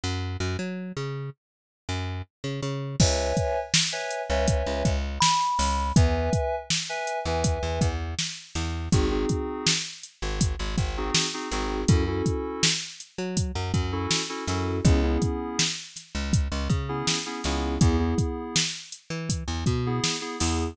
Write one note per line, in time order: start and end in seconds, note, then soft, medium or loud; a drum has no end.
0.04 0.37 F#2 medium
0.40 0.57 F#2 medium
0.59 0.92 F#3 medium
0.97 1.30 C#3 medium
1.89 2.22 F#2 medium
2.44 2.61 C#3 medium
2.63 2.96 C#3 medium
3.00 3.33 C#2 medium
3.00 3.59 B4 medium
3.00 3.59 C#5 medium
3.00 3.59 E5 medium
3.00 3.59 G#5 medium
3.00 kick medium
3.00 crash medium
3.37 kick medium
3.37 closed hi-hat medium
3.74 snare loud
3.92 4.22 B4 medium
3.92 4.22 C#5 medium
3.92 4.22 E5 medium
3.92 4.22 G#5 medium
4.11 closed hi-hat medium
4.30 4.63 C#2 medium
4.30 4.89 B4 medium
4.30 4.89 C#5 medium
4.30 4.89 E5 medium
4.30 4.89 G#5 medium
4.48 kick medium
4.48 closed hi-hat medium
4.67 4.83 C#2 medium
4.85 5.19 C#2 medium
4.85 kick medium
4.85 closed hi-hat medium
5.21 5.92 B5 medium
5.21 snare loud
5.59 5.92 C#2 medium
5.59 snare soft
5.59 open hi-hat medium
5.96 6.30 E2 medium
5.96 6.55 B4 loud
5.96 6.55 E5 medium
5.96 6.55 G#5 medium
5.96 kick medium
5.96 closed hi-hat medium
6.33 kick medium
6.33 closed hi-hat medium
6.70 snare medium
6.89 7.19 B4 medium
6.89 7.19 E5 medium
6.89 7.19 G#5 medium
7.07 closed hi-hat medium
7.25 7.59 E2 medium
7.25 7.86 B4 medium
7.25 7.86 E5 medium
7.25 7.86 G#5 medium
7.44 kick medium
7.44 closed hi-hat medium
7.63 7.79 E2 medium
7.81 8.15 E2 medium
7.81 kick medium
7.81 closed hi-hat medium
8.19 snare medium
8.55 8.89 E2 medium
8.55 snare soft
8.55 closed hi-hat medium
8.92 9.26 G#1 medium
8.92 9.08 C4 medium
8.92 9.08 D#4 medium
8.92 9.08 F#4 loud
8.92 9.08 G#4 medium
8.92 kick medium
8.92 closed hi-hat medium
9.11 9.70 C4 medium
9.11 9.70 D#4 medium
9.11 9.70 F#4 medium
9.11 9.70 G#4 medium
9.29 kick medium
9.29 closed hi-hat medium
9.67 snare loud
10.03 closed hi-hat medium
10.22 10.56 G#1 medium
10.41 kick medium
10.41 closed hi-hat medium
10.59 10.76 G#1 medium
10.78 11.11 G#1 medium
10.78 kick medium
10.78 closed hi-hat medium
10.97 11.27 C4 medium
10.97 11.27 D#4 medium
10.97 11.27 F#4 medium
10.97 11.27 G#4 medium
11.15 snare medium
11.34 11.48 C4 medium
11.34 11.48 D#4 medium
11.34 11.48 F#4 medium
11.34 11.48 G#4 medium
11.52 11.85 G#1 medium
11.52 11.81 C4 medium
11.52 11.81 D#4 medium
11.52 11.81 F#4 medium
11.52 11.81 G#4 medium
11.52 snare soft
11.52 closed hi-hat medium
11.88 12.22 F#2 medium
11.88 12.03 C#4 medium
11.88 12.03 E4 medium
11.88 12.03 F#4 medium
11.88 12.03 A4 medium
11.88 kick medium
11.88 closed hi-hat medium
12.07 12.67 C#4 medium
12.07 12.67 E4 medium
12.07 12.67 F#4 medium
12.07 12.67 A4 medium
12.26 kick medium
12.26 closed hi-hat medium
12.63 snare loud
13.00 closed hi-hat medium
13.18 13.52 F#3 medium
13.37 kick medium
13.37 closed hi-hat medium
13.55 13.72 F#2 medium
13.74 14.07 F#2 medium
13.74 kick medium
13.74 closed hi-hat medium
13.92 14.22 C#4 medium
13.92 14.22 E4 medium
13.92 14.22 F#4 medium
13.92 14.22 A4 medium
14.11 snare medium
14.29 14.44 C#4 medium
14.29 14.44 E4 medium
14.29 14.44 F#4 medium
14.29 14.44 A4 medium
14.48 14.81 F#2 medium
14.48 14.78 C#4 medium
14.48 14.78 E4 medium
14.48 14.78 F#4 medium
14.48 14.78 A4 medium
14.48 snare soft
14.48 closed hi-hat medium
14.85 15.18 C#2 medium
14.85 15.00 B3 medium
14.85 15.00 C#4 loud
14.85 15.00 E4 medium
14.85 15.00 G#4 loud
14.85 kick medium
14.85 closed hi-hat medium
15.03 15.62 B3 medium
15.03 15.62 C#4 medium
15.03 15.62 E4 medium
15.03 15.62 G#4 medium
15.22 kick medium
15.22 closed hi-hat medium
15.59 snare medium
15.96 snare soft
15.96 closed hi-hat medium
16.15 16.48 C#2 medium
16.33 kick medium
16.33 closed hi-hat medium
16.52 16.68 C#2 medium
16.70 17.03 C#3 medium
16.70 kick medium
16.70 closed hi-hat medium
16.89 17.18 B3 medium
16.89 17.18 C#4 medium
16.89 17.18 E4 medium
16.89 17.18 G#4 medium
17.07 snare medium
17.26 17.41 B3 medium
17.26 17.41 C#4 medium
17.26 17.41 E4 medium
17.26 17.41 G#4 medium
17.44 17.78 C#2 medium
17.44 17.75 B3 medium
17.44 17.75 C#4 medium
17.44 17.75 E4 medium
17.44 17.75 G#4 medium
17.44 snare medium
17.44 closed hi-hat medium
17.81 18.15 E2 medium
17.81 17.96 B3 medium
17.81 17.96 E4 medium
17.81 17.96 G#4 medium
17.81 kick medium
17.81 closed hi-hat medium
17.99 18.59 B3 medium
17.99 18.59 E4 medium
17.99 18.59 G#4 medium
18.18 kick medium
18.18 closed hi-hat medium
18.56 snare medium
18.92 closed hi-hat medium
19.10 19.44 E3 medium
19.29 kick medium
19.29 closed hi-hat medium
19.48 19.64 E2 medium
19.66 20.00 B2 medium
19.66 kick medium
19.66 closed hi-hat medium
19.86 20.16 B3 medium
19.86 20.16 E4 medium
19.86 20.16 G#4 medium
20.04 snare medium
20.21 20.36 B3 medium
20.21 20.36 E4 medium
20.21 20.36 G#4 medium
20.39 20.74 E2 medium
20.39 20.69 B3 medium
20.39 20.69 E4 medium
20.39 20.69 G#4 medium
20.39 snare medium
20.39 open hi-hat medium